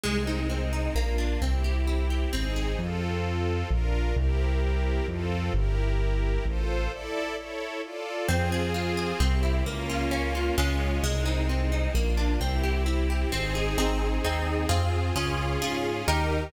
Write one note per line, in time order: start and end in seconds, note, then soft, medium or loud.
0.03 0.89 C2 loud
0.03 0.24 G#3 loud
0.03 0.95 G#3 medium
0.03 0.95 C4 medium
0.03 0.95 D#4 medium
0.27 0.48 D#4 medium
0.50 0.70 C4 medium
0.73 0.93 D#4 medium
0.95 1.37 A#1 loud
0.95 1.16 A#3 medium
0.95 1.41 A#3 medium
0.95 1.41 D4 medium
0.95 1.41 F4 medium
1.18 1.39 D4 medium
1.41 2.26 C2 loud
1.41 2.32 C4 medium
1.41 1.62 C4 medium
1.41 2.32 E4 medium
1.41 2.32 G4 medium
1.64 1.85 G4 medium
1.87 2.08 E4 medium
2.10 2.31 G4 medium
2.33 2.76 G#1 medium
2.33 2.53 C4 loud
2.33 2.78 C4 medium
2.33 2.79 D#4 medium
2.33 2.79 G#4 medium
2.56 2.77 G#4 medium
2.78 3.63 F2 loud
2.78 3.69 C4 medium
2.78 3.69 F4 medium
2.78 3.69 A4 medium
3.70 4.13 A#1 loud
3.70 4.15 D4 medium
3.70 4.15 F4 medium
3.70 4.15 A#4 loud
4.16 5.01 C2 loud
4.16 5.06 C4 medium
4.16 5.06 E4 medium
4.16 5.06 G4 loud
4.16 5.06 A#4 medium
5.07 5.50 F2 loud
5.07 5.53 C4 medium
5.07 5.53 F4 medium
5.07 5.53 A4 medium
5.54 6.38 G1 loud
5.54 6.45 E4 medium
5.54 6.45 G4 medium
5.54 6.45 A#4 loud
6.46 6.88 A1 loud
6.46 6.92 F4 medium
6.46 6.91 A4 medium
6.46 6.92 C5 loud
6.91 7.35 E4 medium
6.91 7.35 A4 loud
6.91 7.37 D5 medium
7.36 7.81 E4 medium
7.36 7.81 A4 medium
7.36 7.81 C#5 medium
7.83 8.28 F4 medium
7.83 8.28 A4 medium
7.83 8.28 D5 medium
8.28 9.13 F2 loud
8.28 8.49 C4 loud
8.28 9.19 C4 loud
8.28 9.19 F4 loud
8.28 9.19 G#4 loud
8.52 8.73 G#4 loud
8.74 8.95 F4 medium
8.97 9.18 G#4 medium
9.20 9.62 C2 loud
9.20 9.41 C4 loud
9.20 9.65 C4 medium
9.20 9.65 E4 medium
9.20 9.65 G4 medium
9.43 9.63 E4 medium
9.65 10.50 C#2 loud
9.65 10.56 A#3 loud
9.65 9.87 A#3 loud
9.65 10.56 C#4 medium
9.65 10.56 F4 medium
9.90 10.10 F4 medium
10.11 10.32 C#4 medium
10.35 10.56 F4 medium
10.58 11.00 C#2 loud
10.58 10.99 G#3 loud
10.58 11.03 G#3 medium
10.58 10.99 C#4 loud
10.58 11.03 C#4 loud
10.58 10.99 F4 loud
10.58 11.03 F4 medium
11.03 11.88 C2 loud
11.03 11.94 G#3 medium
11.03 11.24 G#3 loud
11.03 11.94 C4 loud
11.03 11.94 D#4 medium
11.26 11.46 D#4 medium
11.49 11.70 C4 medium
11.72 11.93 D#4 medium
11.95 12.37 A#1 loud
11.95 12.40 A#3 medium
11.95 12.15 A#3 loud
11.95 12.40 D4 medium
11.95 12.40 F4 medium
12.17 12.38 D4 medium
12.40 13.25 C2 loud
12.40 13.31 C4 medium
12.40 12.61 C4 loud
12.40 13.31 E4 loud
12.40 13.31 G4 medium
12.63 12.84 G4 medium
12.86 13.07 E4 loud
13.10 13.31 G4 medium
13.32 13.75 G#1 loud
13.32 13.53 C4 loud
13.32 13.77 C4 medium
13.32 13.77 D#4 loud
13.32 13.77 G#4 loud
13.55 13.76 G#4 medium
13.78 14.19 G#1 loud
13.78 14.19 C4 loud
13.78 14.69 C4 medium
13.78 14.19 D#4 loud
13.78 14.69 D#4 medium
13.78 14.19 G#4 loud
13.78 14.69 G#4 medium
14.24 14.66 D#2 medium
14.24 14.66 C4 loud
14.24 14.66 D#4 loud
14.24 14.66 G#4 loud
14.69 15.12 F2 loud
14.69 15.10 C4 loud
14.69 15.15 C4 medium
14.69 15.10 F4 loud
14.69 15.15 F4 loud
14.69 15.10 G#4 loud
14.69 15.15 G#4 medium
15.16 15.57 C#2 loud
15.16 16.06 C#4 medium
15.16 15.57 C#4 loud
15.16 16.06 F4 medium
15.16 15.57 F4 loud
15.16 16.06 G#4 medium
15.16 15.57 G#4 loud
15.61 16.02 G#2 medium
15.61 16.03 C#4 medium
15.61 16.03 F4 loud
15.61 16.03 G#4 loud
16.07 16.50 D#2 loud
16.07 16.52 D#4 medium
16.07 16.49 D#4 loud
16.07 16.52 G4 medium
16.07 16.49 G4 loud
16.07 16.52 A#4 loud
16.07 16.49 A#4 loud